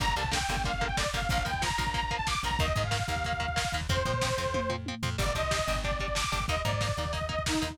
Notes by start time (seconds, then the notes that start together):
0.00 G1 D3 G3 A#3 A#5, kick, crash
0.08 kick
0.16 C2 D3 G3 A#3 A5, kick, closed hi-hat
0.24 kick
0.31 D3 G3 A#3 G5, kick, snare
0.41 kick
0.49 G1 D3 G3 A#3, kick, closed hi-hat
0.57 kick
0.64 D3 G3 A#3 F5, kick, closed hi-hat
0.74 F5, kick
0.81 D3 G3 A#3, kick, closed hi-hat
0.87 G5, kick
0.97 D3 G3 A#3 D5, kick, snare
1.06 kick
1.13 G1 D3 G3 A#3 F5, kick, closed hi-hat
1.22 kick
1.29 A#1 F3 A#3 F5, kick, closed hi-hat
1.38 kick
1.45 D#2 F3 A#3 G5, kick, closed hi-hat
1.54 kick
1.62 F3 A#3 A#5, kick, snare
1.70 kick
1.78 A#1 F3 A#3, kick, closed hi-hat
1.87 kick
1.94 F3 A#3 A#5, kick, closed hi-hat
2.03 A#5, kick
2.11 F3 A#3, kick, closed hi-hat
2.16 A5, kick
2.27 F3 A#3 D6, kick, snare
2.35 kick
2.43 A#1 F3 A#3 A#5, kick, closed hi-hat
2.51 kick
2.59 D#2 D#3 A#3 D#5, kick, closed hi-hat
2.68 kick
2.75 G#2 D#3 A#3, kick, closed hi-hat
2.84 F5, kick
2.91 D#3 A#3, kick, snare
3.00 kick
3.08 D#2 D#3 A#3 F5, kick, closed hi-hat
3.16 kick
3.24 D#3 A#3, kick, closed hi-hat
3.33 kick
3.40 D#3 A#3, kick, closed hi-hat
3.48 kick
3.56 D#3 A#3, kick, snare
3.65 kick
3.72 D#2 D#3 A#3, kick, closed hi-hat
3.81 kick
3.89 F2 F3 C4 C5, kick, closed hi-hat
3.97 kick
4.05 A#2 F3 C4, kick, closed hi-hat
4.14 kick
4.21 F3 C4, kick, snare
4.30 kick
4.38 F2 F3 C4, kick, closed hi-hat
4.46 kick
4.54 F3 C4, kick, high tom
4.70 F3 C4, floor tom
4.86 F3 C4, high tom
5.03 F2 F3 C4, floor tom
5.18 G1 G3 D4 D5, kick, crash
5.26 kick
5.35 C2 G3 D4 D#5, kick, closed hi-hat
5.43 kick
5.51 G3 D4, kick, snare
5.59 kick
5.67 G1 G3 D4, kick, closed hi-hat
5.75 kick
5.84 G3 D4 D5, kick, closed hi-hat
5.91 kick
6.00 G3 D4 D5, kick, closed hi-hat
6.08 kick
6.15 G3 D4 D6, kick, snare
6.24 kick
6.32 G1 G3 D4, kick, closed hi-hat
6.40 kick
6.48 D#2 A#3 D#4 D#5, kick, closed hi-hat
6.57 kick
6.65 G#2 A#3 D#4 D5, kick, closed hi-hat
6.72 kick
6.81 A#3 D#4, kick, snare
6.89 kick
6.97 D#2 A#3 D#4, kick, closed hi-hat
7.05 kick
7.13 A#3 D#4 D#5, kick, closed hi-hat
7.21 kick
7.29 A#3 D#4 D#5, kick, closed hi-hat
7.39 kick
7.46 A#3 D#4, kick, snare
7.55 kick
7.62 D#2 A#3 D#4, kick, closed hi-hat
7.70 kick